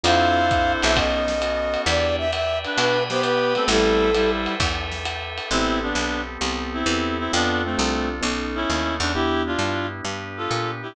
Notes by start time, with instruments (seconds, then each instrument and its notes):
0.04 electric bass (finger) F2, electric piano 1 C4 D4 F4 A4, drawbar organ C4 D4 F4 A4, clarinet E4 C5, flute F5, ride
0.51 drawbar organ C4 D4 A4 C5, kick, hi-hat pedal, ride
0.82 electric bass (finger) B1, flute E5, ride
0.95 electric piano 1 B3 C#4 D#4 A4, drawbar organ B3 C#4 D#4 A4, flute D#5, kick, ride
1.28 snare
1.42 drawbar organ B3 C#4 F#4 A4, hi-hat pedal, ride
1.74 ride
1.86 electric bass (finger) E2, electric piano 1 B3 D4 E4 G4, drawbar organ B4 D5 E5 G5, flute D5, ride
2.18 flute E5
2.33 flute E5, hi-hat pedal, ride
2.64 clarinet D4 B4, ride
2.77 electric bass (finger) B2, flute B4, drawbar organ B4 D5 G5 B5, ride
3.10 clarinet B3 G4, flute C5, snare
3.23 flute B4, hi-hat pedal, ride
3.55 electric piano 1 A3 B3 C4 G4, clarinet C4 A4, ride
3.68 electric bass (finger) A1, clarinet G3 E4, flute A4, drawbar organ A4 B4 C5 G5, ride
4.14 clarinet G3 E4, hi-hat pedal, ride
4.46 ride
4.60 electric bass (finger) E2, drawbar organ A4 B4 E5 G5, kick, ride
4.91 snare
5.05 hi-hat pedal, ride
5.38 ride
5.51 electric bass (finger) A1, drawbar organ B3 C4 G4 A4, electric piano 1 B3 C4 G4 A4, clarinet C4 E4
5.82 clarinet B3 D4
5.95 electric bass (finger) B1
6.41 electric bass (finger) C2, electric piano 1 B3 C4 G4 A4
6.74 clarinet C4 E4
6.86 electric bass (finger) E2, electric piano 1 B3 C4 G4 A4
7.19 clarinet C4 E4
7.32 electric bass (finger) F2, clarinet B3 D4, electric piano 1 C4 D4 F4 A4, drawbar organ C4 D4 F4 A4
7.64 clarinet A3 C4
7.77 electric bass (finger) C2, electric piano 1 C4 D4 F4 A4
8.21 electric bass (finger) B1, electric piano 1 B3 C#4 D#4 A4, drawbar organ B3 C#4 D#4 A4
8.55 clarinet C#4 E4
8.70 electric bass (finger) D#2
9.00 electric bass (finger) E2, clarinet D4
9.15 drawbar organ B3 D4 E4 G4, electric piano 1 B3 D4 E4 G4, clarinet E4 G4
9.46 clarinet D4 F4
9.59 electric bass (finger) G2
10.05 electric bass (finger) G2, drawbar organ B3 D4 G4 B4
10.37 clarinet F4 A4
10.51 electric bass (finger) A#2
10.83 clarinet E4 G4